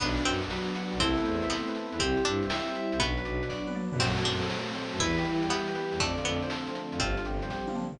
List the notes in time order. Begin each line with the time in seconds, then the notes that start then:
0.00 B1 B3 D4 F#4 B4, kick, crash
0.17 F#4 D5, closed hi-hat
0.25 F#2 B3 C4 F#5, closed hi-hat
0.42 B1 D4 D5, closed hi-hat
0.49 F#3 B3 B4, snare
0.68 F#4 D5, closed hi-hat
0.75 D4 F#5, closed hi-hat
0.92 B1 B3 D5, closed hi-hat
0.99 C2 A3 B3 C4 E4 A4, kick, closed hi-hat
1.17 B3 B4, closed hi-hat
1.25 E2 C4 C5, closed hi-hat
1.42 C2 E4 E5, closed hi-hat
1.50 A3 B3 C5, snare
1.67 B3 B4, closed hi-hat
1.74 C4 A4, closed hi-hat
1.92 E2 E4 B4, closed hi-hat
1.99 C2 G3 C4 E4 G4, kick, closed hi-hat
2.17 E4 C5, closed hi-hat
2.25 G2 G3 D4 E5, closed hi-hat
2.43 C2 C4 C5, closed hi-hat
2.49 G3 G4 E5, snare
2.67 E4 C5, closed hi-hat
2.75 C4 E5, closed hi-hat
2.92 C2 G3 C5, closed hi-hat
2.99 B1 F#3 B3 D4 F#4 B4, kick, closed hi-hat
3.17 D4 B4, closed hi-hat
3.25 B1 F#3 D5, closed hi-hat
3.41 B1 B3 B4, closed hi-hat
3.50 F#3 F#4 D5, kick, snare
3.67 D4 B4, high tom
3.75 B3 D5, mid tom
3.92 F#2 F#3 B4, floor tom
3.99 F#2 F#3 A3 C4 F#4, kick, crash
4.17 C4 A4, closed hi-hat
4.25 F#2 F#3 D4 C5, closed hi-hat
4.42 F#3 A3 A4, closed hi-hat
4.50 F#3 F#4, snare
4.67 C4 A4, closed hi-hat
4.75 A3 C5, closed hi-hat
4.92 F#2 F#3 A4, closed hi-hat
5.00 E2 E3 G3 B3 E4 B4, kick, closed hi-hat
5.17 B3 G4, closed hi-hat
5.25 E3 B4, closed hi-hat
5.42 E2 G3 G4, closed hi-hat
5.50 E3 B3 E4 G4, snare
5.67 B3 G4, closed hi-hat
5.75 G3 B4, closed hi-hat
5.92 E2 E3 G4, closed hi-hat
6.00 F2 D3 F3 A3 C4 D4 D5, kick, closed hi-hat
6.17 F3 F4, closed hi-hat
6.25 F2 A3 B3 A4, closed hi-hat
6.42 F3 C4 C5, closed hi-hat
6.50 D3 A4, snare
6.67 F3 F4, closed hi-hat
6.75 A3 D4, closed hi-hat
6.92 F2 C4 F4, closed hi-hat
6.99 G1 D3 F3 G3 C4 D4 F4, kick, closed hi-hat
7.17 F3 F4, closed hi-hat
7.25 G1 G3 G4, closed hi-hat
7.42 G1 C4 C5, closed hi-hat
7.50 D3 G4, kick, snare
7.67 F3 F4, high tom
7.75 G3 D4, mid tom
7.92 G1 C4 F4, floor tom